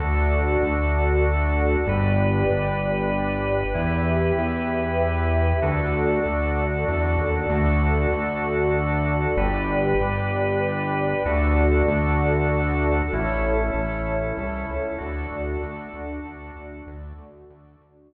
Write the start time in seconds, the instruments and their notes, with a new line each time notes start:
0.00 synth bass 1 D2, drawbar organ D4 F#4 A4, pad 2 (warm) F#4 A4 D5
0.62 synth bass 1 D2
1.87 synth bass 1 G1, drawbar organ D4 G4 B4, pad 2 (warm) G4 B4 D5
2.50 synth bass 1 G1
3.74 synth bass 1 E2, drawbar organ E4 G4 B4, pad 2 (warm) G4 B4 E5
4.38 synth bass 1 E2
5.62 synth bass 1 D2, drawbar organ D4 F#4 A4, pad 2 (warm) F#4 A4 D5
6.26 synth bass 1 D2
6.88 synth bass 1 E2
7.18 synth bass 1 D#2
7.50 synth bass 1 D2, drawbar organ D4 F#4 A4, pad 2 (warm) F#4 A4 D5
8.13 synth bass 1 D2
9.37 synth bass 1 G1, drawbar organ D4 G4 B4, pad 2 (warm) G4 B4 D5
10.00 synth bass 1 G1
11.25 synth bass 1 D2, drawbar organ D4 F#4 A4, pad 2 (warm) F#4 A4 D5
11.88 synth bass 1 D2
13.12 synth bass 1 A1, drawbar organ C#4 E4 A4, pad 2 (warm) E4 A4 C#5
13.74 synth bass 1 A1
14.38 synth bass 1 C2
14.70 synth bass 1 C#2
14.98 synth bass 1 D2, drawbar organ D4 F#4 A4, pad 2 (warm) F#4 A4 D5
15.31 synth bass 1 D2
15.63 synth bass 1 D2
15.93 synth bass 1 D2, pad 2 (warm) D4 F#4 D5
16.25 synth bass 1 D2
16.56 synth bass 1 D2
16.87 synth bass 1 D2, pad 2 (warm) F#4 A4 D5
17.18 synth bass 1 D2
17.50 synth bass 1 D2
17.81 synth bass 1 D2, pad 2 (warm) D4 F#4 D5